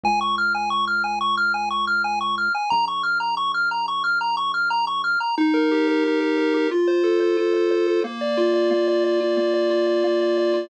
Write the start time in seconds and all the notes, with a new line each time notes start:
0.03 C#2 G#5
0.21 C#6
0.38 F6
0.55 G#5
0.70 C#6
0.87 F6
1.04 G#5
1.21 C#6
1.37 F6
1.54 G#5
1.70 C#6
1.87 F6
2.04 G#5
2.21 C#6
2.38 F6
2.55 G#5
2.70 A#1 A#5
2.88 C#6
3.03 F6
3.20 A#5
3.37 C#6
3.54 F6
3.71 A#5
3.88 C#6
4.04 F6
4.21 A#5
4.37 C#6
4.54 F6
4.70 A#5
4.87 C#6
5.04 F6
5.20 A#5
5.38 D#4
5.54 A#4
5.71 G4
5.88 A#4
6.04 D#4
6.20 A#4
6.38 A#4
6.54 G4
6.71 F4
6.87 C5
7.04 A4
7.20 C5
7.37 F4
7.54 C5
7.71 C5
7.87 A4
8.04 A#3
8.21 D5
8.37 F4
8.54 D5
8.71 A#3
8.88 D5
9.04 D5
9.21 F4
9.37 A#3
9.54 D5
9.70 F4
9.87 D5
10.04 A#3
10.21 D5
10.38 D5
10.54 F4